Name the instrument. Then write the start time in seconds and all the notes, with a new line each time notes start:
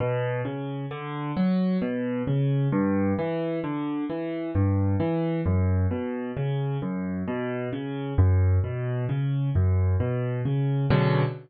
acoustic grand piano
0.00 B2
0.45 C#3
0.91 D3
1.37 F#3
1.82 B2
2.27 C#3
2.72 G2
3.19 E3
3.64 D3
4.09 E3
4.55 G2
5.00 E3
5.46 F#2
5.91 B2
6.37 C#3
6.82 F#2
7.28 B2
7.73 C#3
8.18 F#2
8.64 B2
9.09 C#3
9.55 F#2
10.00 B2
10.45 C#3
10.90 B2 C#3 D3 F#3